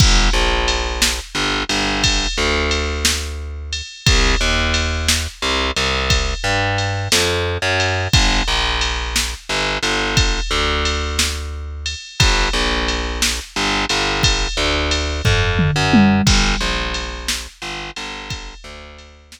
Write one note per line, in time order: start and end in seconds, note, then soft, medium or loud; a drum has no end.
0.00 0.29 G1 loud
0.00 kick loud
0.00 crash loud
0.33 1.20 A#1 medium
0.68 ride medium
1.02 snare loud
1.35 1.64 G1 medium
1.69 2.27 G1 medium
1.69 ride medium
2.04 kick medium
2.04 ride loud
2.38 3.82 D2 medium
2.71 ride medium
3.05 snare loud
3.73 ride medium
4.06 4.35 C2 loud
4.06 kick loud
4.06 ride loud
4.41 5.27 D#2 medium
4.74 ride medium
5.08 snare loud
5.42 5.71 C2 medium
5.76 6.34 C2 medium
5.76 ride medium
6.10 kick medium
6.10 ride loud
6.44 7.08 G2 medium
6.78 ride medium
7.12 7.58 F2 medium
7.12 snare loud
7.62 8.08 F#2 medium
7.80 ride medium
8.13 8.42 G1 loud
8.13 kick loud
8.13 ride loud
8.48 9.34 A#1 medium
8.81 ride medium
9.16 snare loud
9.49 9.78 G1 medium
9.83 10.40 G1 medium
9.83 ride medium
10.17 kick loud
10.17 ride loud
10.51 11.95 D2 medium
10.85 ride medium
11.19 snare loud
11.86 ride medium
12.20 12.49 G1 loud
12.20 kick loud
12.20 ride loud
12.53 13.40 A#1 medium
12.88 ride medium
13.22 snare loud
13.56 13.85 G1 loud
13.89 14.47 G1 medium
13.89 ride medium
14.23 kick medium
14.23 ride loud
14.57 15.21 D2 medium
14.91 ride medium
15.25 15.71 F2 medium
15.25 kick medium
15.25 floor tom medium
15.59 mid tom loud
15.76 16.22 F#2 medium
15.93 high tom loud
16.27 16.55 G1 medium
16.27 kick loud
16.27 crash loud
16.61 17.47 A#1 medium
16.94 ride medium
17.28 snare loud
17.62 17.91 G1 medium
17.96 18.54 G1 medium
17.96 ride medium
18.30 kick medium
18.30 ride loud
18.64 19.40 D2 medium
18.98 ride medium
19.32 snare loud